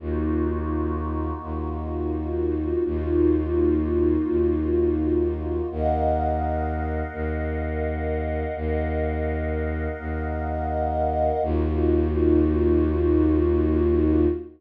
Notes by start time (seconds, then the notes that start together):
0.00 D#2 A#3 D#4 F4 F#4
1.42 D#2
2.85 D#2 A#3 D#4 F4 F#4
4.29 D#2
5.71 D#2 A#4 D#5 F5 F#5
7.13 D#2
8.56 D#2 A#4 D#5 F5 F#5
9.99 D#2
11.43 D#2 A#3 D#4 F4 F#4